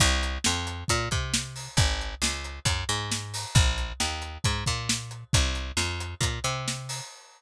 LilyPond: <<
  \new Staff \with { instrumentName = "Electric Bass (finger)" } { \clef bass \time 4/4 \key c \minor \tempo 4 = 135 c,4 f,4 bes,8 c4. | aes,,4 des,4 ges,8 aes,4. | bes,,4 ees,4 aes,8 bes,4. | c,4 f,4 bes,8 c4. | }
  \new DrumStaff \with { instrumentName = "Drums" } \drummode { \time 4/4 <hh bd>8 hh8 sn8 hh8 <hh bd>8 <hh bd>8 sn8 hho8 | <hh bd>8 hh8 sn8 hh8 <hh bd>8 hh8 sn8 hho8 | <hh bd>8 hh8 sn8 hh8 <hh bd>8 <hh bd>8 sn8 hh8 | <hh bd>8 hh8 sn8 hh8 <hh bd>8 hh8 sn8 hho8 | }
>>